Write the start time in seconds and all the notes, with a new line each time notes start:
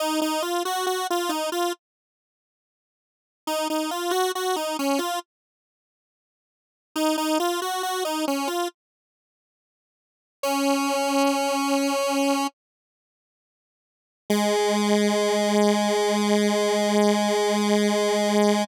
0.00 D#4
0.22 D#4
0.42 F4
0.65 F#4
0.86 F#4
1.10 F4
1.29 D#4
1.52 F4
3.47 D#4
3.70 D#4
3.91 F4
4.11 F#4
4.35 F#4
4.56 D#4
4.79 C#4
4.99 F4
6.96 D#4
7.18 D#4
7.40 F4
7.62 F#4
7.83 F#4
8.05 D#4
8.28 C#4
8.47 F4
10.43 C#4
14.30 G#3